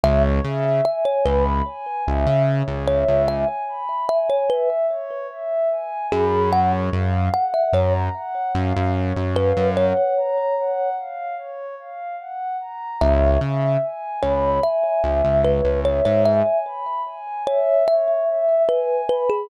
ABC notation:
X:1
M:4/4
L:1/16
Q:1/4=74
K:C#dor
V:1 name="Kalimba"
e z3 e c B z7 c2 | e z3 e c B z7 G2 | f z3 f e c z7 B2 | c6 z10 |
e2 z4 c2 e4 B2 c c | e2 z4 c2 e4 B2 B G |]
V:2 name="Pad 2 (warm)"
c2 e2 g2 b2 g2 e2 c2 e2 | g2 b2 g2 e2 c2 e2 g2 b2 | c2 ^e2 f2 a2 f2 e2 c2 e2 | f2 a2 f2 ^e2 c2 e2 f2 a2 |
c2 e2 g2 b2 g2 e2 c2 e2 | g2 b2 g2 e2 c2 e2 g2 b2 |]
V:3 name="Synth Bass 1" clef=bass
C,,2 C,4 C,,4 C,, C,2 C,,2 C,,- | C,,14 F,,2- | F,,2 F,,4 F,,4 F,, F,,2 F,,2 F,,- | F,,16 |
C,,2 C,4 C,,4 C,, C,,2 C,,2 G,,- | G,,16 |]